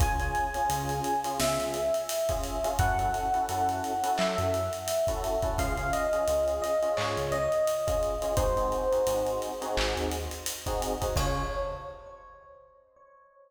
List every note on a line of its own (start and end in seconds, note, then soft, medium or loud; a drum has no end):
0.00 0.32 C#2 loud
0.00 0.16 C#4 medium
0.00 0.16 F4 medium
0.00 0.16 G#4 medium
0.00 1.18 G#5 loud
0.00 kick loud
0.00 closed hi-hat loud
0.20 0.47 C#4 medium
0.20 0.47 F4 medium
0.20 0.47 G#4 medium
0.20 closed hi-hat medium
0.35 closed hi-hat medium
0.54 0.67 C#4 medium
0.54 0.67 F4 medium
0.54 0.67 G#4 medium
0.54 closed hi-hat medium
0.69 1.01 C#2 loud
0.69 1.12 C#4 medium
0.69 1.12 F4 medium
0.69 1.12 G#4 medium
0.69 closed hi-hat loud
0.89 closed hi-hat medium
1.04 closed hi-hat medium
1.24 1.78 C#4 medium
1.24 1.78 F4 medium
1.24 1.78 G#4 medium
1.24 closed hi-hat medium
1.40 1.58 C#2 medium
1.40 2.69 E5 medium
1.40 snare loud
1.59 1.90 C#2 medium
1.59 closed hi-hat medium
1.74 closed hi-hat medium
1.94 closed hi-hat medium
2.09 closed hi-hat loud
2.29 2.56 C#4 medium
2.29 2.56 F4 medium
2.29 2.56 G#4 medium
2.29 kick medium
2.29 closed hi-hat medium
2.43 closed hi-hat medium
2.64 2.76 C#4 medium
2.64 2.76 F4 medium
2.64 2.76 G#4 medium
2.64 closed hi-hat medium
2.79 3.11 F#2 loud
2.79 2.95 C#4 medium
2.79 2.95 E4 medium
2.79 2.95 F#4 loud
2.79 2.95 A4 medium
2.79 4.11 F#5 loud
2.79 kick loud
2.79 closed hi-hat loud
2.99 3.26 C#4 medium
2.99 3.26 E4 medium
2.99 3.26 F#4 medium
2.99 3.26 A4 medium
2.99 closed hi-hat medium
3.14 closed hi-hat medium
3.34 3.46 C#4 medium
3.34 3.46 E4 medium
3.34 3.46 F#4 medium
3.34 3.46 A4 medium
3.34 closed hi-hat medium
3.49 3.81 F#2 medium
3.49 3.92 C#4 medium
3.49 3.92 E4 medium
3.49 3.92 F#4 medium
3.49 3.92 A4 medium
3.49 closed hi-hat loud
3.69 closed hi-hat medium
3.84 closed hi-hat medium
4.03 4.57 C#4 medium
4.03 4.57 E4 medium
4.03 4.57 F#4 medium
4.03 4.57 A4 medium
4.03 closed hi-hat loud
4.18 4.36 F#3 medium
4.18 5.49 E5 medium
4.18 clap loud
4.38 4.69 F#2 loud
4.38 closed hi-hat medium
4.54 closed hi-hat medium
4.73 closed hi-hat medium
4.88 closed hi-hat loud
5.07 5.35 C#4 medium
5.07 5.35 E4 medium
5.07 5.35 F#4 medium
5.07 5.35 A4 medium
5.07 kick medium
5.07 closed hi-hat medium
5.24 closed hi-hat medium
5.42 5.55 C#4 medium
5.42 5.55 E4 medium
5.42 5.55 F#4 medium
5.42 5.55 A4 medium
5.42 kick loud
5.42 closed hi-hat medium
5.58 5.91 C#2 loud
5.58 5.74 C#4 medium
5.58 5.74 F4 medium
5.58 5.74 G#4 loud
5.58 5.89 F5 loud
5.58 kick loud
5.58 closed hi-hat loud
5.77 6.05 C#4 medium
5.77 6.05 F4 medium
5.77 6.05 G#4 medium
5.77 closed hi-hat medium
5.93 6.54 D#5 medium
5.93 closed hi-hat loud
6.13 6.25 C#4 medium
6.13 6.25 F4 medium
6.13 6.25 G#4 medium
6.13 closed hi-hat medium
6.28 6.60 C#2 medium
6.28 6.71 C#4 medium
6.28 6.71 F4 medium
6.28 6.71 G#4 medium
6.28 closed hi-hat loud
6.48 closed hi-hat medium
6.62 6.94 D#5 medium
6.62 closed hi-hat medium
6.83 7.36 C#4 medium
6.83 7.36 F4 medium
6.83 7.36 G#4 medium
6.83 closed hi-hat medium
6.97 7.16 G#2 medium
6.97 7.26 C#5 medium
6.97 clap loud
7.17 7.48 C#2 medium
7.17 closed hi-hat medium
7.32 8.28 D#5 loud
7.32 closed hi-hat medium
7.52 closed hi-hat medium
7.67 closed hi-hat loud
7.87 8.14 C#4 medium
7.87 8.14 F4 medium
7.87 8.14 G#4 medium
7.87 kick loud
7.87 closed hi-hat loud
8.03 closed hi-hat medium
8.22 8.34 C#4 medium
8.22 8.34 F4 medium
8.22 8.34 G#4 medium
8.22 closed hi-hat medium
8.36 8.69 G#1 loud
8.36 8.53 C4 medium
8.36 8.53 D#4 loud
8.36 8.53 F#4 loud
8.36 8.53 G#4 loud
8.36 9.31 C5 loud
8.36 kick loud
8.36 closed hi-hat loud
8.57 8.84 C4 medium
8.57 8.84 D#4 medium
8.57 8.84 F#4 medium
8.57 8.84 G#4 medium
8.57 closed hi-hat medium
8.72 closed hi-hat medium
8.92 9.04 C4 medium
8.92 9.04 D#4 medium
8.92 9.04 F#4 medium
8.92 9.04 G#4 medium
8.92 closed hi-hat medium
9.07 9.39 G#1 medium
9.07 9.50 C4 medium
9.07 9.50 D#4 medium
9.07 9.50 F#4 medium
9.07 9.50 G#4 medium
9.07 closed hi-hat loud
9.27 closed hi-hat medium
9.42 closed hi-hat medium
9.62 10.16 C4 medium
9.62 10.16 D#4 medium
9.62 10.16 F#4 medium
9.62 10.16 G#4 medium
9.62 closed hi-hat medium
9.77 9.95 G#1 loud
9.77 clap loud
9.97 10.28 D#2 medium
9.97 closed hi-hat medium
10.11 closed hi-hat loud
10.31 closed hi-hat medium
10.46 closed hi-hat loud
10.66 10.93 C4 medium
10.66 10.93 D#4 medium
10.66 10.93 F#4 medium
10.66 10.93 G#4 medium
10.66 kick medium
10.66 closed hi-hat medium
10.82 closed hi-hat loud
11.01 11.13 C4 medium
11.01 11.13 D#4 medium
11.01 11.13 F#4 medium
11.01 11.13 G#4 medium
11.01 kick medium
11.01 closed hi-hat medium
11.16 11.42 C#2 loud
11.16 11.42 C#4 loud
11.16 11.42 F4 loud
11.16 11.42 G#4 medium
11.16 11.42 C#5 loud
11.16 kick loud
11.16 crash loud